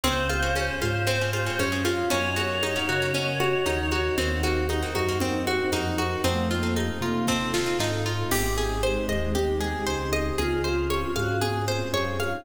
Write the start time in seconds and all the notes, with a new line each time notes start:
0.03 C#2 C4 C#4 F4 G#4 C5, low conga
0.29 F4, high conga
0.42 C4 C#4 F4 G#4
0.55 C#4, high conga
0.81 G#2 F4 C5, high conga
1.07 C4 C#4 F4 G#4, low conga
1.21 C4 C#4 F4 G#4
1.33 F4, high conga
1.46 C4 C#4 F4 G#4
1.59 F#2 C#4, high conga
1.72 C4 C#4 F4 G#4
1.85 C4 C#4 F4 G#4, high conga
2.10 F#2 A#3 C#4 D#4 F#4 A#4 C#5 D#5 F#5, low conga
2.36 A#3 C#4 D#4 F#4, high conga
2.63 D#4, high conga
2.76 A#3 C#4 D#4 F#4
2.89 C#3 F#4
3.02 A#3 C#4 D#4 F#4
3.14 C#4, low conga
3.40 F#4, high conga
3.66 D#2 A#3 C#4 D#4 F#4, high conga
3.91 F#4, high conga
4.18 D#2 A#3 C4 D#4 F#4 A#4 C5 D#5 F#5, low conga
4.43 A#3 C4 D#4 F#4, high conga
4.69 D#4, high conga
4.82 A#3 C4 D#4 F#4
4.95 F#2 D#4 F#4, high conga
5.09 A#3 C4 D#4 F#4
5.20 C4, low conga
5.47 F#4, high conga
5.72 F2 A#3 C4 D#4 F#4, high conga
5.98 F#4, high conga
6.24 F2 A3 C4 D#4 F4 A4, low conga
6.51 A#3 F4
6.63 C4 D#4 F4 A4
6.76 D#4, high conga
7.01 C3 F4
7.27 C4 D#4 F4 A4, kick, snare
7.54 C4 D#4 F4 A4, snare
7.66 C4 D#4 F4 A4
7.79 G#2 C4 D#4 F4 A4, snare
8.06 F4
8.31 G#1 C4 D#4 G4 G#4, crash, low conga
8.58 G#4
8.83 G#3 C5, high conga
9.08 D#2 D#5, high conga
9.35 G4, low conga
9.60 G#4, high conga
9.87 C#2 C5
10.13 D#5, high conga
10.36 C#2 C4 C#4 F4 G#4, low conga
10.63 F4 C5, high conga
10.90 C#5, high conga
11.15 G#2 F#4 F5, high conga
11.41 G#4, low conga
11.68 C5
11.93 F#2 C#5, high conga
12.20 F5, high conga
12.31 D#4